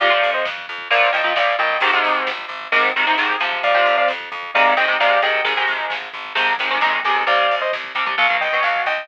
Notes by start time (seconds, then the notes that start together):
0.00 F2 C3 F3 D5 F5, kick, crash
0.10 C3 F3, kick
0.23 F2, kick, closed hi-hat
0.34 C5 D#5, kick
0.45 F2, kick, snare
0.58 kick
0.68 F2, kick, closed hi-hat
0.78 kick
0.91 A#1 A#2 F3 D5 F5, kick, closed hi-hat
1.01 kick
1.12 A#1 A#2 F3 D#5 G5, kick, closed hi-hat
1.24 A#2 F3, kick
1.36 A#1 A#2 F3 D5 F5, kick, snare
1.48 kick
1.58 A#1 A#2 F3 D#5 G5, kick, closed hi-hat
1.70 kick
1.80 G#1 G#2 C3 D#3, kick, closed hi-hat
1.93 G#2 C3 D#3, kick
2.04 G#1, kick, closed hi-hat
2.15 kick
2.27 G#1, kick, snare
2.39 kick
2.49 G#1, kick, closed hi-hat
2.61 kick
2.72 G#1 G#2 C3 D#3, kick, closed hi-hat
2.85 kick
2.96 G#1 G#2 C3 D#3, kick, closed hi-hat
3.07 G#2 C3 D#3, kick
3.17 G#1 G#2 C3 D#3, kick, snare
3.29 kick
3.40 G#1 C3 F3, kick, closed hi-hat
3.53 kick
3.63 F2 D5 F5, kick, closed hi-hat
3.74 C3 F3, kick
3.86 F2, kick, closed hi-hat
3.98 D5 F5, kick
4.08 F2, kick, snare
4.21 kick
4.32 F2, kick, closed hi-hat
4.43 kick
4.54 G#1 C3 D#3 G#3 D5 F5, kick, closed hi-hat
4.65 kick
4.76 G#1 C3 D#3 G#3 D#5 G5, kick, closed hi-hat
4.88 C3 D#3 G#3, kick
5.00 G#1 C3 D#3 G#3 D5 F5, kick, snare
5.10 kick
5.22 G#1 C3 D#3 G#3 D#5 G5, kick, closed hi-hat
5.34 kick
5.45 G#1 C3 D#3 G#3, kick, closed hi-hat
5.57 C3 D#3 G#3, kick
5.67 G#1, kick, closed hi-hat
5.79 kick
5.90 G#1, kick, snare
6.02 kick
6.13 G#1, kick, closed hi-hat
6.25 kick
6.35 G#1 C3 D#3 G#3, kick, closed hi-hat
6.47 kick
6.58 G#1 C3 D#3 G#3, kick, closed hi-hat
6.69 C3 D#3 G#3, kick
6.80 A#1 C3 D#3 G#3, kick, snare
6.93 kick
7.04 B1 C3 D#3 G#3, kick, closed hi-hat
7.16 kick
7.26 C2 C3 G3 D5 F5, kick, closed hi-hat
7.39 kick
7.49 C2, kick, closed hi-hat
7.61 C5 D#5, kick
7.73 C2, kick, snare
7.84 kick
7.95 C2 C3 G3, kick, closed hi-hat
8.06 C3 G3, kick
8.18 B1 B2 F#3 F5, kick, closed hi-hat
8.30 B2 F#3, kick
8.40 B1 D#5 G5, kick, closed hi-hat
8.52 B2 F#3, kick
8.63 B1 F5, kick, snare
8.76 kick
8.85 B1 D#5 G5, kick, closed hi-hat
8.98 kick